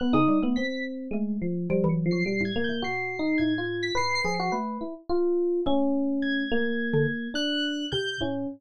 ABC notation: X:1
M:5/4
L:1/16
Q:1/4=106
K:none
V:1 name="Electric Piano 1"
B, ^D2 B, C4 ^G,2 F,2 (3=G,2 ^F,2 =F,2 G,2 ^A,2 | (3^F4 ^D4 =F4 B2 ^G ^F B2 E z =F4 | ^C6 ^A,6 D4 z2 C2 |]
V:2 name="Xylophone"
z ^C, G, A, z4 A,4 F, E,2 ^F, B,, A,,2 A,, | B,,4 A,,4 A,,2 F,2 A,2 z6 | A,8 z D, z6 C,2 A,,2 |]
V:3 name="Electric Piano 1"
^f' ^d'2 z b'2 z9 c'' (3c''2 ^g'2 =g'2 | c''4 ^g'3 b' (3c''2 c''2 c''2 z8 | z4 ^g'8 ^f'4 =g'2 z2 |]